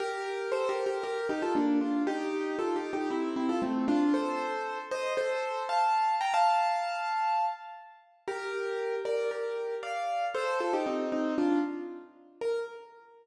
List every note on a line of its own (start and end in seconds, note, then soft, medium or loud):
0.00 0.50 G4 loud
0.00 0.50 A#4 loud
0.52 0.68 A4 medium
0.52 0.68 C5 loud
0.69 0.85 G4 medium
0.69 0.85 A#4 loud
0.86 1.03 G4 medium
0.86 1.03 A#4 loud
1.03 1.27 G4 medium
1.03 1.27 A#4 loud
1.29 1.42 D#4 medium
1.29 1.42 G4 loud
1.42 1.55 F4 medium
1.42 1.55 A4 loud
1.55 1.79 A#3 medium
1.55 1.79 D4 loud
1.81 2.02 D4 medium
1.81 2.02 F4 medium
2.07 2.56 D#4 loud
2.07 2.56 G4 loud
2.59 2.75 F4 medium
2.59 2.75 A4 medium
2.76 2.92 D#4 medium
2.76 2.92 G4 medium
2.93 3.09 D#4 medium
2.93 3.09 G4 loud
3.10 3.34 C4 medium
3.10 3.34 E4 loud
3.36 3.48 C4 medium
3.36 3.48 E4 medium
3.49 3.61 F4 medium
3.49 3.61 A4 loud
3.62 3.86 A3 medium
3.62 3.86 C4 medium
3.88 4.13 D4 loud
3.88 4.13 F4 loud
4.14 4.79 A4 medium
4.14 4.79 C5 loud
4.91 5.13 C5 loud
4.91 5.13 D#5 loud
5.17 5.63 A4 medium
5.17 5.63 C5 loud
5.69 6.15 F5 medium
5.69 6.15 A5 medium
6.21 6.33 G5 medium
6.21 6.33 A#5 loud
6.34 7.45 F5 medium
6.34 7.45 A5 loud
8.28 8.95 G4 loud
8.28 8.95 A#4 loud
9.05 9.30 A#4 medium
9.05 9.30 D5 medium
9.31 9.75 G4 medium
9.31 9.75 A#4 medium
9.83 10.25 D5 medium
9.83 10.25 F5 medium
10.34 10.59 A4 loud
10.34 10.59 C5 loud
10.60 10.73 F4 medium
10.60 10.73 A4 loud
10.73 10.86 D#4 medium
10.73 10.86 G4 loud
10.86 11.10 C4 medium
10.86 11.10 D#4 medium
11.12 11.35 C4 medium
11.12 11.35 D#4 medium
11.38 11.59 D4 medium
11.38 11.59 F4 loud
12.41 12.59 A#4 loud